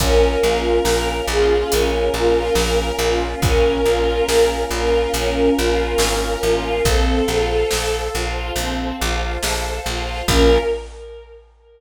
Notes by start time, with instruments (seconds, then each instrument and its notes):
0.00 electric bass (finger) A#1, choir aahs A#3 C#4 F4, string ensemble 1 C#4, violin A#4, kick, closed hi-hat
0.43 electric bass (finger) A#1, string ensemble 1 F4
0.85 electric bass (finger) A#1, string ensemble 1 A#4, snare
1.28 electric bass (finger) A#1, string ensemble 1 F4, violin G#4
1.71 electric bass (finger) A#1, string ensemble 1 C#4, violin A#4, closed hi-hat
2.14 electric bass (finger) A#1, string ensemble 1 F4
2.55 electric bass (finger) A#1, string ensemble 1 A#4, snare
2.99 electric bass (finger) A#1, string ensemble 1 F4
3.42 electric bass (finger) A#1, string ensemble 1 C#4, violin A#4, kick, closed hi-hat
3.86 electric bass (finger) A#1, string ensemble 1 F4
4.28 electric bass (finger) A#1, string ensemble 1 A#4, snare
4.71 electric bass (finger) A#1, string ensemble 1 F4, violin A#4
5.14 electric bass (finger) A#1, string ensemble 1 C#4, violin A#4, closed hi-hat
5.57 electric bass (finger) A#1, string ensemble 1 F4
5.98 electric bass (finger) G#1, string ensemble 1 A#4, snare
6.43 electric bass (finger) A1, string ensemble 1 F4
6.85 electric bass (finger) A#1, string ensemble 1 C4, choir aahs A4 C5 F5, violin A4, kick, closed hi-hat
7.28 electric bass (finger) A#1, string ensemble 1 F4
7.71 electric bass (finger) A#1, string ensemble 1 A4, snare
8.14 electric bass (finger) A#1, string ensemble 1 F4
8.56 electric bass (finger) A#1, string ensemble 1 C4, closed hi-hat
9.00 electric bass (finger) A#1, string ensemble 1 F4
9.43 electric bass (finger) A#1, string ensemble 1 A4, snare
9.86 electric bass (finger) A#1, string ensemble 1 F4
10.28 electric bass (finger) A#1, choir aahs A#3 C#4 F4, string ensemble 1 C#4 F4 A#4, violin A#4, kick, crash